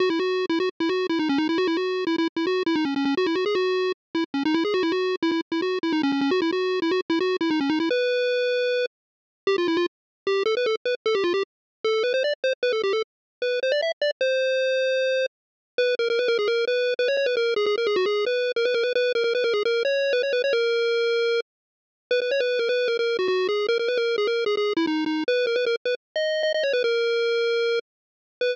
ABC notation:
X:1
M:4/4
L:1/16
Q:1/4=152
K:B
V:1 name="Lead 1 (square)"
F E F3 E F z E F2 E D C D E | F E F3 E E z E F2 E D C C C | F E F G F4 z2 E z C D E G | F E F3 E E z E F2 E D C C C |
F E F3 E F z E F2 E D C D E | B10 z6 | [K:C] G F E F z4 G2 A B A z B z | A G F G z4 A2 B c d z c z |
B A G A z4 B2 c d e z d z | c12 z4 | [K:B] B2 A A B A G A2 B3 B c c B | A2 G G A G F G2 B3 A B A B |
B2 A A B A G A2 c3 B c B c | A10 z6 | B B c B2 A B2 A A2 F F2 G2 | A A B A2 G A2 G G2 E D2 D2 |
B2 A B A z B z2 d3 d d c B | A10 z6 | B4 z12 |]